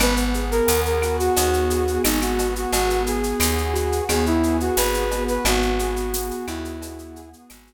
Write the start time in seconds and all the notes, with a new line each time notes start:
0.00 G#1 B3 B4, cowbell, claves, shaker
0.17 shaker
0.34 G#4, shaker
0.51 A#4, shaker
0.67 D#2 B3, tambourine, shaker
0.85 A#4, shaker
1.02 F#4, claves, shaker
1.19 F#4, shaker
1.36 D#2 B3, cowbell, shaker
1.53 shaker
1.70 G#4, shaker
1.87 shaker
2.04 G#1 D#4 F#4, tambourine, cowbell, claves, shaker
2.21 F#4, claves, shaker
2.39 B3, cowbell, shaker
2.56 F#4, shaker
2.72 G#1 B3 F#4, cowbell, shaker
2.90 shaker
3.06 G#4, shaker
3.23 shaker
3.40 D#2 B3, tambourine, claves, shaker
3.58 shaker
3.73 F#4, shaker
3.92 shaker
4.09 D#2 B3 G#4, cowbell, claves, shaker
4.26 E4, shaker
4.43 G#4, shaker
4.60 F#4, shaker
4.77 G#1 F#4 B4, tambourine, cowbell, shaker
4.94 shaker
5.11 B3, cowbell, shaker
5.28 B4, shaker
5.45 G#1 B3 F#4, cowbell, claves, shaker
5.62 shaker
5.79 G#4, shaker
5.96 shaker
6.14 B3, tambourine, shaker
6.31 shaker
6.47 D#2 E4 F#4, claves, shaker
6.65 shaker
6.82 B3, cowbell, shaker
6.99 shaker
7.16 G#4, shaker
7.33 shaker
7.50 G#1 F#4, tambourine, cowbell, claves, shaker
7.67 shaker